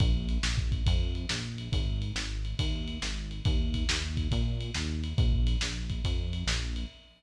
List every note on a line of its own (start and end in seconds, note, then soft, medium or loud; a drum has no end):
0.00 0.38 A#1 medium
0.00 kick loud
0.00 ride loud
0.29 ride medium
0.43 0.82 A#1 medium
0.43 snare loud
0.58 kick medium
0.72 kick medium
0.72 ride medium
0.86 1.26 F2 medium
0.86 kick medium
0.86 ride loud
1.15 ride medium
1.29 1.69 A#1 medium
1.29 snare loud
1.58 ride medium
1.72 2.12 G#1 medium
1.72 kick loud
1.72 ride loud
2.02 ride medium
2.15 2.54 G#1 medium
2.15 snare loud
2.45 ride medium
2.59 2.98 D#2 medium
2.59 kick medium
2.59 ride loud
2.88 ride medium
3.02 3.41 G#1 medium
3.02 snare loud
3.31 ride medium
3.45 3.84 D#2 medium
3.45 kick loud
3.45 ride loud
3.74 kick medium
3.74 ride medium
3.89 4.28 D#2 medium
3.89 snare loud
4.17 kick medium
4.17 ride medium
4.31 4.71 A#2 medium
4.31 kick medium
4.31 ride loud
4.61 ride medium
4.74 5.14 D#2 medium
4.74 snare loud
5.04 ride medium
5.17 5.56 A#1 medium
5.17 kick loud
5.17 ride medium
5.33 kick medium
5.47 ride medium
5.61 6.01 A#1 medium
5.61 snare loud
5.90 kick medium
5.90 ride medium
6.04 6.44 F2 medium
6.04 kick medium
6.04 ride loud
6.33 ride medium
6.46 6.85 A#1 medium
6.46 snare loud
6.76 ride medium